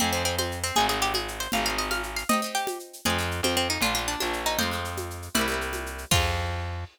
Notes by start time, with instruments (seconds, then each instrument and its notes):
0.00 electric bass (finger) F2, acoustic guitar (steel) C4 F4, pizzicato strings C4, low conga, shaker
0.04 acoustic guitar (steel) G#4
0.13 pizzicato strings C4, acoustic guitar (steel) C4 F4, shaker
0.17 acoustic guitar (steel) G#4
0.25 pizzicato strings C4, shaker
0.38 pizzicato strings C4, high conga, shaker
0.51 shaker
0.64 pizzicato strings C4, shaker
0.75 electric bass (finger) G#1, acoustic guitar (steel) C4 D#4, pizzicato strings G#4, low conga, shaker
0.80 acoustic guitar (steel) G#4
0.89 acoustic guitar (steel) C4 D#4, pizzicato strings G#4, shaker
0.93 acoustic guitar (steel) G#4
1.02 pizzicato strings G4, shaker
1.14 pizzicato strings G#4, high conga, shaker
1.28 shaker
1.40 pizzicato strings C5, shaker
1.52 electric bass (finger) G#1, acoustic guitar (steel) C4 F4, pizzicato strings F5, low conga, shaker
1.57 acoustic guitar (steel) G#4
1.65 acoustic guitar (steel) C4 F4, pizzicato strings F5, shaker
1.70 acoustic guitar (steel) G#4
1.78 pizzicato strings D#5, shaker
1.91 pizzicato strings F5, high conga, shaker
2.03 shaker
2.16 pizzicato strings F5, shaker
2.29 acoustic guitar (steel) C4 D#4, pizzicato strings D#5, low conga, shaker
2.33 acoustic guitar (steel) G4
2.42 acoustic guitar (steel) C4 D#4, shaker
2.46 acoustic guitar (steel) G4
2.55 pizzicato strings G4, shaker
2.67 high conga, shaker
2.79 shaker
2.93 shaker
3.05 electric bass (finger) F2, acoustic guitar (steel) C4 F4, pizzicato strings G#4, low conga, shaker
3.10 acoustic guitar (steel) G#4
3.18 acoustic guitar (steel) C4 F4, shaker
3.23 acoustic guitar (steel) G#4
3.31 shaker
3.43 electric bass (finger) F2, pizzicato strings C4, high conga, shaker
3.57 pizzicato strings C4, shaker
3.69 pizzicato strings D#4, shaker
3.81 electric bass (finger) A#1, acoustic guitar (steel) A#3 D4, pizzicato strings F4, low conga, shaker
3.86 acoustic guitar (steel) F4
3.95 acoustic guitar (steel) A#3 D4, pizzicato strings F4, shaker
3.99 acoustic guitar (steel) F4
4.08 pizzicato strings D4, shaker
4.20 electric bass (finger) A#1, pizzicato strings D4, high conga, shaker
4.33 shaker
4.46 pizzicato strings D#4, shaker
4.58 electric bass (finger) F2, acoustic guitar (steel) G#3 C4, pizzicato strings C5, low conga, shaker
4.63 acoustic guitar (steel) F4
4.71 acoustic guitar (steel) G#3 C4, shaker
4.75 acoustic guitar (steel) F4
4.85 shaker
4.97 high conga, shaker
5.10 shaker
5.22 shaker
5.34 electric bass (finger) C2, acoustic guitar (steel) G3 A#3, pizzicato strings E4, low conga, shaker
5.39 acoustic guitar (steel) C4 E4
5.48 acoustic guitar (steel) G3 A#3, shaker
5.52 acoustic guitar (steel) C4 E4
5.61 shaker
5.73 high conga, shaker
5.86 shaker
5.98 shaker
6.11 electric bass (finger) F2, acoustic guitar (steel) C4 F4, pizzicato strings F4, kick, crash
6.15 acoustic guitar (steel) G#4